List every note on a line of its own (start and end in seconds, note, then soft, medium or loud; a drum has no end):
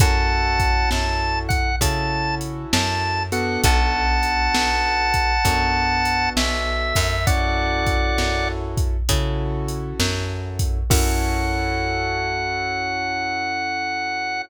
0.00 0.85 F#2 medium
0.00 1.70 C#4 medium
0.00 1.70 E4 medium
0.00 1.70 F#4 medium
0.00 1.70 A4 medium
0.00 0.90 F#5 loud
0.00 0.90 A5 loud
0.00 kick loud
0.00 closed hi-hat medium
0.59 kick medium
0.59 closed hi-hat medium
0.91 1.77 F#2 medium
0.91 1.39 A5 loud
0.91 snare medium
1.49 1.76 F#5 loud
1.49 kick medium
1.49 closed hi-hat medium
1.81 2.66 C#3 medium
1.81 3.22 C#4 medium
1.81 3.22 E4 medium
1.81 3.22 F#4 medium
1.81 3.22 A4 medium
1.81 2.35 A5 loud
1.81 kick medium
1.81 closed hi-hat loud
2.41 closed hi-hat medium
2.73 3.58 F#2 medium
2.73 3.23 A5 loud
2.73 snare loud
3.32 5.33 B3 medium
3.32 5.33 D4 medium
3.32 5.33 F#4 medium
3.32 5.33 A4 medium
3.32 3.61 F#5 medium
3.32 closed hi-hat medium
3.64 4.49 B1 loud
3.64 6.30 F#5 loud
3.64 6.30 A5 loud
3.64 kick medium
3.64 closed hi-hat loud
4.23 closed hi-hat medium
4.55 5.39 B1 medium
4.55 snare loud
5.14 kick medium
5.14 closed hi-hat medium
5.45 6.29 F#2 medium
5.45 7.15 B3 medium
5.45 7.15 D4 medium
5.45 7.15 F#4 medium
5.45 7.15 A4 medium
5.45 kick medium
5.45 closed hi-hat loud
6.05 closed hi-hat medium
6.37 6.93 B1 medium
6.37 7.26 E5 loud
6.37 snare loud
6.95 8.12 F#2 loud
6.95 kick medium
6.95 open hi-hat medium
7.27 8.96 C#4 medium
7.27 8.96 E4 medium
7.27 8.96 F#4 medium
7.27 8.96 A4 medium
7.27 8.48 D5 loud
7.27 8.48 F#5 loud
7.27 kick medium
7.27 closed hi-hat medium
7.87 kick medium
7.87 closed hi-hat medium
8.18 9.03 F#2 medium
8.18 snare medium
8.77 kick medium
8.77 closed hi-hat medium
9.09 9.94 C#3 medium
9.09 10.79 C#4 medium
9.09 10.79 E4 medium
9.09 10.79 F#4 medium
9.09 10.79 A4 medium
9.09 kick medium
9.09 closed hi-hat loud
9.68 closed hi-hat medium
10.00 10.84 F#2 medium
10.00 snare medium
10.59 kick medium
10.59 closed hi-hat medium
10.90 14.42 F#2 loud
10.90 14.41 C#4 loud
10.90 14.41 E4 loud
10.90 14.41 F#4 loud
10.90 14.41 A4 loud
10.90 14.42 F#5 loud
10.90 kick loud
10.90 crash loud